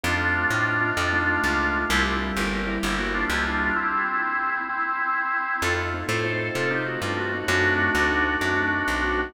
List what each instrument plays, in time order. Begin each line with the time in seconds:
0.03 electric bass (finger) F2, acoustic grand piano A3 C4 D#4 F4, drawbar organ D4 F4
0.51 electric bass (finger) A2
0.81 acoustic grand piano A3 C4 D#4 F4
0.97 electric bass (finger) F2, drawbar organ D4 F4
1.13 acoustic grand piano A3 C4 D#4 F4
1.44 electric bass (finger) C#2
1.89 electric bass (finger) C2, acoustic grand piano G3 A#3 C4 E4, drawbar organ E4 G4
2.37 electric bass (finger) G1, drawbar organ G4 A#4
2.67 acoustic grand piano G3 A#3 C4 E4
2.83 electric bass (finger) G1, drawbar organ E4 G4
2.99 acoustic grand piano G3 A#3 C4 E4, drawbar organ F#4
3.14 drawbar organ D4 F4
3.30 electric bass (finger) C#2, drawbar organ E4 G4
3.45 drawbar organ D4 F4
3.76 drawbar organ C4 E4
4.69 drawbar organ C4 E4
5.62 electric bass (finger) F2, acoustic grand piano A3 C4 D#4 F4, drawbar organ F4 A4
5.94 acoustic grand piano A3 C4 D#4 F4
6.08 electric bass (finger) A2, acoustic grand piano A3 C4 D#4 F4, drawbar organ A4 C5
6.25 acoustic grand piano A3 C4 D#4 F4
6.55 electric bass (finger) C3, drawbar organ F4 A4
6.71 acoustic grand piano A3 C4 D#4 F4, drawbar organ D#4 G4
6.86 drawbar organ F#4
7.02 electric bass (finger) G2, drawbar organ D4 F4
7.17 acoustic grand piano A3 C4 D#4 F4, drawbar organ F#4
7.34 acoustic grand piano A3 C4 D#4 F4
7.48 electric bass (finger) F#2, acoustic grand piano A3 C4 D#4 F#4, drawbar organ D4 F#4
7.79 acoustic grand piano A3 C4 D#4 F#4
7.95 electric bass (finger) D2, acoustic grand piano A3 C4 D#4 F#4
8.11 acoustic grand piano A3 C4 D#4 F#4
8.41 electric bass (finger) F#2, drawbar organ D4 F#4
8.58 acoustic grand piano A3 C4 D#4 F#4
8.88 electric bass (finger) B1
9.03 acoustic grand piano A3 C4 D#4 F#4
9.18 acoustic grand piano A3 C4 D#4 F#4